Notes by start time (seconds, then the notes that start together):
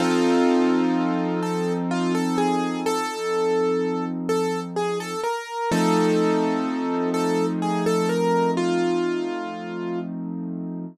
0.00 F3 C4 D#4 F4 A4
1.43 A4
1.91 F4
2.15 A4
2.38 G#4
2.86 A4
4.29 A4
4.76 G#4
5.00 A4
5.24 A#4
5.71 F3 A3 C4 D#4 A4
7.14 A4
7.62 G#4
7.86 A4
8.09 A#4
8.57 F4